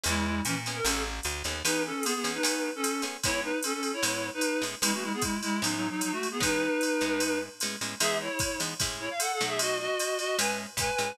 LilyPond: <<
  \new Staff \with { instrumentName = "Clarinet" } { \time 4/4 \key e \major \tempo 4 = 151 <gis e'>4 <e cis'>16 r8 bes'16 <cis' a'>8 r4. | <dis' b'>8 <cis' a'>8 <b gis'>16 <b gis'>8 <dis' b'>4 <cis' a'>8. r8 | <e' cis''>8 <dis' b'>8 <cis' a'>16 <cis' a'>8 <e' cis''>4 <dis' b'>8. r8 | <gis e'>16 <a fis'>16 <gis e'>16 <b gis'>16 <gis e'>8 <gis e'>8 \tuplet 3/2 { <fis dis'>8 <fis dis'>8 <fis dis'>8 } <fis dis'>16 <a fis'>8 <b gis'>16 |
<dis' b'>2. r4 | <gis' e''>8 <e' cis''>4 r4 <e' cis''>16 eis''16 \tuplet 3/2 { <a' fis''>8 <a' fis''>8 <gis' e''>8 } | <fis' dis''>8 <fis' dis''>4 <fis' dis''>8 <b' gis''>8 r8 <b' gis''>4 | }
  \new Staff \with { instrumentName = "Acoustic Guitar (steel)" } { \time 4/4 \key e \major <b cis' e' gis'>4. <b cis' e' gis'>8 <b cis' gis' a'>4. <b cis' gis' a'>8 | <e b cis' gis'>4. <e b cis' gis'>8 <a b cis' gis'>4. <a b cis' gis'>8 | <gis b cis' e'>2 <a, gis b cis'>4. <a, gis b cis'>8 | <e gis b cis'>2 <a, gis b cis'>2 |
<e gis b cis'>4. <a, gis b cis'>4. <a, gis b cis'>8 <a, gis b cis'>8 | <e gis b dis'>4. <e gis b dis'>8 <a, gis cis' e'>4. <b, fis a dis'>8~ | <b, fis a dis'>2 <a, gis cis' e'>4 <a, gis cis' e'>8 <a, gis cis' e'>8 | }
  \new Staff \with { instrumentName = "Electric Bass (finger)" } { \clef bass \time 4/4 \key e \major e,4 ais,4 a,,4 d,8 dis,8 | r1 | r1 | r1 |
r1 | r1 | r1 | }
  \new DrumStaff \with { instrumentName = "Drums" } \drummode { \time 4/4 cymr4 <hhp cymr>8 cymr8 cymr4 <hhp cymr>8 cymr8 | cymr4 <hhp cymr>8 cymr8 cymr4 <hhp cymr>8 cymr8 | <bd cymr>4 <hhp cymr>8 cymr8 cymr4 <hhp cymr>8 cymr8 | cymr4 <hhp bd cymr>8 cymr8 cymr4 <hhp cymr>8 cymr8 |
<bd cymr>4 <hhp cymr>8 cymr8 cymr4 <hhp cymr>8 cymr8 | cymr4 <hhp bd cymr>8 cymr8 <bd cymr>4 <hhp cymr>8 cymr8 | cymr4 <hhp cymr>8 cymr8 cymr4 <hhp bd cymr>8 cymr8 | }
>>